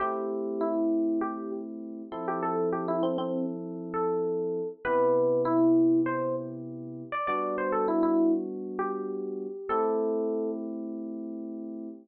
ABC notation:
X:1
M:4/4
L:1/16
Q:1/4=99
K:Am
V:1 name="Electric Piano 1"
G4 E4 G2 z5 G | A2 G E C C2 z3 A6 | B4 E4 c2 z5 d | d2 c A E E2 z3 G6 |
A6 z10 |]
V:2 name="Electric Piano 1"
[A,CEG]14 [F,CEA]2- | [F,CEA]16 | [C,B,EG]16 | [G,B,D^F]16 |
[A,CEG]16 |]